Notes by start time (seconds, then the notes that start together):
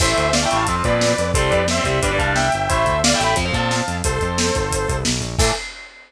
0.00 A1 E3 A3 C5 E5, kick, crash
0.17 D2, closed hi-hat
0.33 D5 F5, snare
0.43 E3 A3 E5 G5
0.50 A1 E3 A3, closed hi-hat
0.55 F5 A5
0.67 F2 F3 C4, kick, closed hi-hat
0.75 F3 C4
0.84 A#2 F3 C4 B4 D5, kick, closed hi-hat
1.01 snare
1.18 F2, closed hi-hat
1.34 C2 G3 C4 A4 C5, kick, closed hi-hat
1.50 F2 B4 D5, kick, closed hi-hat
1.68 C5 E5, snare
1.77 G3 C4
1.83 C2 G3 C4 C5 E5, kick, closed hi-hat
2.02 G1 G3 D4 B4 D5, kick, closed hi-hat
2.11 G3 D4
2.18 C2 G3 D4 F5 A5, kick, closed hi-hat
2.35 E5 G5, snare
2.52 G1, closed hi-hat
2.69 A1 A3 E4 C5 E5, kick, closed hi-hat
2.86 D2, kick, closed hi-hat
3.04 D5 F5, snare
3.13 A3 E4 E5 G5
3.20 A1 A3 E4, closed hi-hat
3.24 G5 B5
3.36 F2 F3 C4, kick, closed hi-hat
3.45 F3 C4
3.53 A#2 F3 C4 F5 A5, kick, closed hi-hat
3.71 snare
3.88 F2, closed hi-hat
4.04 C2 A4 C5, kick, closed hi-hat
4.21 F2, kick, closed hi-hat
4.38 snare
4.55 G1, kick, closed hi-hat
4.71 kick, closed hi-hat
4.88 C2, kick, closed hi-hat
5.05 B1, snare
5.21 A#1, closed hi-hat
5.38 A2 E3 A3 A4, kick, crash